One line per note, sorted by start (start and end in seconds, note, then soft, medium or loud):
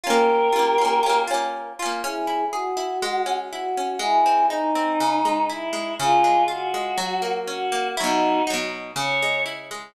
0.04 0.49 C#4 medium
0.04 0.49 F4 medium
0.04 1.20 G4 medium
0.04 1.20 A#4 loud
0.10 0.49 A#3 medium
0.53 0.75 C#4 medium
0.53 0.75 F4 medium
0.59 0.75 A#3 medium
0.78 1.01 C#4 medium
0.78 1.01 F4 medium
0.85 1.01 A#3 medium
1.03 1.26 C#4 medium
1.03 1.26 F4 medium
1.09 1.26 A#3 medium
1.27 1.73 C#4 medium
1.27 1.73 F4 medium
1.34 1.73 A#3 medium
1.79 2.02 C#4 medium
1.79 2.02 F4 medium
1.86 2.02 A#3 medium
2.02 2.98 C#4 medium
2.02 2.45 E4 medium
2.02 2.45 G#4 loud
2.27 2.76 E4 medium
2.52 3.33 F#4 loud
2.52 3.00 G#4 medium
2.77 3.00 E4 medium
3.02 3.97 G#3 medium
3.26 3.77 C#4 medium
3.51 4.00 E4 medium
3.51 3.98 F#4 medium
3.77 4.01 C#4 medium
3.99 4.93 G#3 medium
3.99 4.46 E4 medium
3.99 4.46 G#4 medium
4.26 4.75 C4 medium
4.50 5.44 D#4 medium
4.50 4.97 D#4 medium
4.75 4.99 C4 medium
5.00 5.95 C#3 medium
5.25 5.72 G#3 medium
5.49 5.97 E4 medium
5.49 5.94 E4 medium
5.73 5.96 G#3 medium
5.99 6.94 C#3 medium
5.99 6.43 F4 loud
5.99 6.43 G#4 loud
6.24 6.73 G#3 medium
6.48 6.95 F4 medium
6.48 7.32 F#4 medium
6.74 6.98 G#3 medium
6.98 7.92 F#3 medium
7.22 7.71 A#3 medium
7.47 7.95 C#4 medium
7.47 7.88 F#4 loud
7.72 7.96 A#3 medium
7.97 8.42 F#3 medium
7.97 8.42 D#4 medium
7.97 8.42 E4 medium
7.97 8.42 F#4 loud
8.04 8.42 B2 medium
8.47 8.92 F#3 medium
8.47 8.92 D#4 medium
8.54 8.92 B2 medium
8.96 9.90 C#3 medium
8.96 9.42 C#5 medium
9.22 9.70 G#3 medium
9.46 9.93 E4 medium
9.71 9.94 G#3 medium